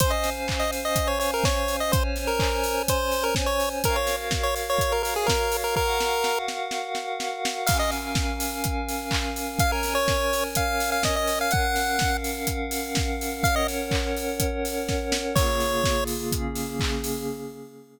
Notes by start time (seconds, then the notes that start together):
0.00 C#4 C5 F5 G#5, kick, closed hi-hat
0.10 D#5
0.24 snare, open hi-hat
0.48 kick, clap
0.59 D#5
0.72 open hi-hat
0.85 D#5
0.96 kick, closed hi-hat
1.07 C#5
1.20 C#5, open hi-hat
1.34 A#4
1.44 C#5, kick, snare
1.68 open hi-hat
1.80 D#5
1.92 C#4 C5 C#5 G#5, kick, closed hi-hat
2.16 snare, open hi-hat
2.27 A#4
2.40 kick, clap
2.64 open hi-hat
2.88 C5, kick, closed hi-hat
3.12 open hi-hat
3.23 A#4
3.35 kick, snare
3.46 C#5
3.60 open hi-hat
3.84 F#4 A#4 C#5 F5, kick, closed hi-hat
3.96 C#5
4.07 snare, open hi-hat
4.31 kick, snare
4.43 C#5
4.56 open hi-hat
4.70 C#5
4.79 kick, closed hi-hat
4.92 A#4
5.03 A#4, open hi-hat
5.16 G#4
5.26 A#4, kick, snare
5.52 open hi-hat
5.64 A#4
5.76 F#4 A#4 F5 F#5, kick
6.00 snare
6.24 snare
6.48 snare
6.71 snare
6.95 snare
7.20 snare
7.45 snare
7.67 C#4 A#4 F5 G#5, kick, crash
7.79 D#5
7.91 snare, open hi-hat
8.15 kick, snare
8.40 open hi-hat
8.64 kick, closed hi-hat
8.89 open hi-hat
9.11 kick, clap
9.36 open hi-hat
9.59 C#4 A#4 C#5 F5 G#5, kick, closed hi-hat
9.72 A#4
9.83 snare, open hi-hat
9.95 C#5
10.08 kick, snare
10.33 open hi-hat
10.55 F5, kick, closed hi-hat
10.80 open hi-hat
10.92 F5
11.03 D#5, kick, snare
11.16 D#5
11.27 open hi-hat
11.41 F5
11.51 C#4 A#4 F5 F#5, kick, closed hi-hat
11.76 snare, open hi-hat
11.99 kick, snare
12.24 open hi-hat
12.47 kick, closed hi-hat
12.71 open hi-hat
12.95 kick, snare
13.21 open hi-hat
13.43 C#4 A#4 C#5 F5 F#5, kick, closed hi-hat
13.56 D#5
13.68 snare, open hi-hat
13.91 kick, clap
14.17 open hi-hat
14.40 kick, closed hi-hat
14.65 open hi-hat
14.88 kick, snare
15.12 snare
15.36 C#3 A#3 F4 G#4 C#5, kick, crash
15.61 snare, open hi-hat
15.84 kick, snare
16.07 open hi-hat
16.32 C#3 A#3 C#4 G#4, kick, closed hi-hat
16.55 open hi-hat
16.80 kick, clap
17.04 open hi-hat